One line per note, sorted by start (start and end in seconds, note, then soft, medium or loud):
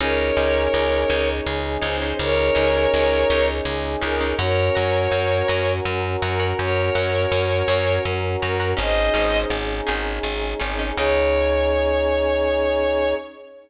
0.00 0.32 C#2 loud
0.00 0.30 C#4 loud
0.00 4.35 C#4 medium
0.00 0.30 D#4 loud
0.00 4.35 D#4 loud
0.00 0.30 G#4 loud
0.00 4.35 G#4 medium
0.00 1.29 A#4 medium
0.00 1.29 C#5 medium
0.37 0.68 C#2 loud
0.37 0.95 C#4 loud
0.37 0.95 D#4 medium
0.37 0.95 G#4 medium
0.74 1.05 C#2 medium
1.10 1.41 C#2 medium
1.10 1.69 C#4 loud
1.10 1.69 D#4 loud
1.10 1.69 G#4 loud
1.46 1.78 C#2 medium
1.82 2.13 C#2 medium
1.82 1.96 C#4 loud
1.82 1.96 D#4 loud
1.82 1.96 G#4 medium
1.82 2.14 C5 medium
2.02 2.46 C#4 medium
2.02 2.46 D#4 medium
2.02 2.46 G#4 medium
2.19 2.50 C#2 medium
2.19 3.46 A#4 medium
2.19 3.46 C#5 loud
2.55 2.87 C#2 medium
2.55 3.13 C#4 medium
2.55 3.13 D#4 loud
2.55 3.13 G#4 medium
2.94 3.25 C#2 medium
3.30 3.61 C#2 loud
3.30 3.89 C#4 loud
3.30 3.89 D#4 medium
3.30 3.89 G#4 loud
3.65 3.96 C#2 medium
4.02 4.34 C#2 loud
4.02 4.16 C#4 loud
4.02 4.16 D#4 loud
4.02 4.16 G#4 loud
4.02 4.35 A#4 medium
4.21 4.35 C#4 loud
4.21 4.35 D#4 medium
4.21 4.35 G#4 medium
4.39 4.70 F#2 loud
4.39 8.74 C#4 medium
4.39 8.74 F#4 loud
4.39 5.72 A#4 medium
4.39 8.74 A#4 loud
4.39 4.68 C#5 loud
4.39 5.72 C#5 medium
4.39 4.68 F#5 loud
4.39 4.68 A#5 loud
4.75 5.08 F#2 medium
4.75 5.34 C#5 medium
4.75 5.34 F#5 medium
4.75 5.34 A#5 loud
5.12 5.43 F#2 medium
5.48 5.80 F#2 medium
5.48 6.07 C#5 loud
5.48 6.07 F#5 loud
5.48 6.07 A#5 loud
5.85 6.16 F#2 medium
6.22 6.53 F#2 medium
6.22 6.55 A#4 medium
6.22 6.37 C#5 loud
6.22 6.37 F#5 loud
6.22 6.37 A#5 medium
6.39 6.83 C#5 medium
6.39 6.83 F#5 medium
6.39 6.83 A#5 medium
6.59 6.90 F#2 medium
6.59 8.02 A#4 medium
6.59 8.02 C#5 medium
6.95 7.26 F#2 medium
6.95 7.54 C#5 medium
6.95 7.54 F#5 loud
6.95 7.54 A#5 loud
7.32 7.63 F#2 medium
7.68 7.99 F#2 medium
7.68 8.28 C#5 loud
7.68 8.28 F#5 medium
7.68 8.28 A#5 medium
8.05 8.36 F#2 medium
8.41 8.74 F#2 medium
8.41 8.71 A#4 medium
8.41 8.57 C#5 loud
8.41 8.57 F#5 loud
8.41 8.57 A#5 medium
8.60 8.74 C#5 medium
8.60 8.74 F#5 loud
8.60 8.74 A#5 loud
8.77 9.10 G#1 loud
8.77 9.06 C#4 loud
8.77 10.95 C#4 medium
8.77 9.06 D#4 loud
8.77 10.95 D#4 medium
8.77 9.06 G#4 loud
8.77 10.95 G#4 medium
8.77 9.38 C5 medium
8.77 9.38 D#5 loud
9.14 9.45 G#1 medium
9.14 9.72 C#4 medium
9.14 9.72 D#4 loud
9.14 9.72 G#4 medium
9.50 9.81 G#1 medium
9.87 10.20 G#1 medium
9.87 10.45 C#4 medium
9.87 10.45 D#4 loud
9.87 10.45 G#4 loud
10.23 10.54 G#1 medium
10.60 10.92 G#1 medium
10.60 10.74 C#4 loud
10.60 10.74 D#4 loud
10.60 10.74 G#4 loud
10.79 10.93 C#4 medium
10.79 10.93 D#4 loud
10.79 10.93 G#4 medium
10.97 13.14 C#2 loud
10.97 13.14 C#4 medium
10.97 13.15 C#4 medium
10.97 13.14 D#4 loud
10.97 13.15 D#4 loud
10.97 13.14 G#4 loud
10.97 13.15 G#4 medium
10.97 13.14 C#5 loud